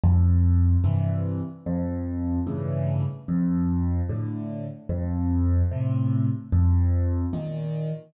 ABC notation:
X:1
M:4/4
L:1/8
Q:1/4=74
K:F
V:1 name="Acoustic Grand Piano" clef=bass
F,,2 [G,,C,E,]2 | F,,2 [G,,A,,^C,E,]2 F,,2 [A,,D,]2 | F,,2 [A,,C,]2 F,,2 [B,,_E,]2 |]